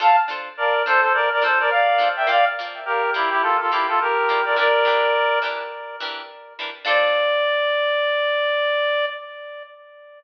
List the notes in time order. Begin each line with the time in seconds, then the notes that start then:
0.00 D4 F4 A4 C5 F5 A5
0.28 D4 F4 A4 C5
0.57 A#4 D5
0.86 D4 F4 A4 C5
1.01 A4 C5
1.14 A#4 D5
1.32 A#4 D5
1.42 D4 F4 A4 C5
1.60 A#4 D5
1.70 D5 F5
1.98 D4 F4 A4 C5
2.16 E5 G5
2.27 A#3 F4 D5 F5
2.59 A#3 F4 D5
2.85 G4 A#4
3.14 A#3 E4 F4 G4 D5
3.31 E4 G4
3.41 F4 A4
3.60 F4 A4
3.71 A#3 E4 F4 G4 D5
3.88 F4 A4
4.01 G4 A#4
4.29 A#3 F4 D5
4.45 A#4 D5
4.56 E3 D4 G4 A#4 D5
4.85 E3 D4 G4 A#4
5.42 E3 D4 G4 A#4
6.00 E3 D4 G4 A#4
6.59 E3 D4 G4 A#4
6.85 D4 F4 A4 C5 D5